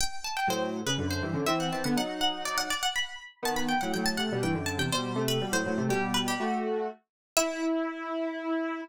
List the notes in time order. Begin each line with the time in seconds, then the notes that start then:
0.01 G5
0.24 A5
0.37 G5
0.47 A2 F#3 C5
0.86 C#3 B4
0.98 F#2 D3
1.11 C5
1.22 G2 E3
1.33 F#2 D3
1.46 E3 C4 E5
1.60 F#5
1.72 E3 C4 A5
1.84 D3 B3 F#5
1.97 F#3 D#4 F#5
2.21 F#5
2.45 D5
2.58 F#5
2.70 D5
2.83 F#5
2.96 B5
3.42 D#3 B3 A5
3.56 B5
3.69 G5
3.81 A2 F#3 F#5
3.94 A2 F#3 G5
4.06 A5
4.17 C3 A3 F#5
4.32 B2 G3
4.43 G2 E3 G5
4.54 F#2 D3
4.66 A5
4.78 E2 C3 G5
4.92 B2 G3 C5
5.16 C3 A3
5.28 B4
5.41 B2 G3
5.52 A2 F#3 C5
5.66 A2 F#3
5.77 C3 A3
5.89 B2 G3 G4
6.14 B4
6.28 G4
6.40 A3 F#4
7.37 E4 E5